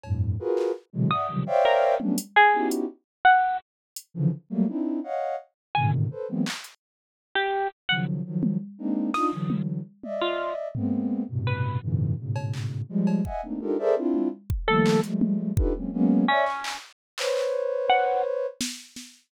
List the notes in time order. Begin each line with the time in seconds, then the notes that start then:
0.03 F2 G2 A2, cowbell
0.39 F4 F#4 G#4 A#4 B4
0.57 clap
0.93 B2 C3 D3 E3 F#3 G#3
1.10 D5 E5 F#5 D#6, floor tom
1.28 C3 C#3 D#3 F3 F#3 G3
1.46 C5 C#5 D5 E5 F5 G5
1.65 A#4
2.00 F#3 G3 A3 B3 C#4 D4, high tom
2.18 closed hi-hat
2.36 G#4
2.53 B3 C#4 D#4 E4 F#4 G4
2.71 closed hi-hat
3.25 F#5
3.96 closed hi-hat
4.14 C#3 D3 E3 F3
4.50 F#3 G3 A3 A#3
4.68 C4 D4 D#4 E4
5.03 C#5 D#5 F5 F#5
5.75 G#2 A2 B2 C3 D3 D#3 G#5
6.11 A4 B4 C5
6.28 E3 F#3 G#3 A#3 B3 C4
6.46 clap
6.64 closed hi-hat
7.35 G4
7.89 C#3 D#3 F3 F#3 F#5
8.25 D#3 F3 F#3
8.43 high tom
8.78 G#3 A#3 C4 D4 D#4
9.14 D4 D#4 F4 D#6, snare
9.32 D3 E3 F#3
9.50 high tom
10.03 D5 D#5 E5, high tom
10.21 F4
10.75 G#3 A#3 B3 C4, floor tom
11.29 G2 A2 B2 C3
11.47 B4
11.82 F#2 G#2 A#2 C3 D3 E3
12.18 G#2 A2 B2 C#3
12.36 cowbell
12.53 clap
12.89 F3 G3 G#3
13.07 cowbell
13.25 D#5 E5 F#5 G#5, kick
13.43 A3 A#3 C4 D4 D#4
13.61 D4 D#4 F4 G4 A4 A#4, high tom
13.79 G#4 A4 A#4 C5 D5 E5
13.96 C4 D4 E4 F4
14.14 high tom
14.50 kick
14.68 D#3 F3 G3 A3 A#3 A4
14.86 clap
15.03 F3 G3 G#3 A3, closed hi-hat
15.21 high tom
15.57 D4 D#4 F4 G4 A4 B4, kick
15.75 F#3 G#3 A#3 C4 C#4
15.93 F#3 G#3 A#3 B3 C#4
16.28 C#4 C#5 D5 E5
16.46 clap
16.64 clap
17.18 B4 C5 C#5, clap
17.36 clap
17.90 F#5
18.61 snare
18.96 snare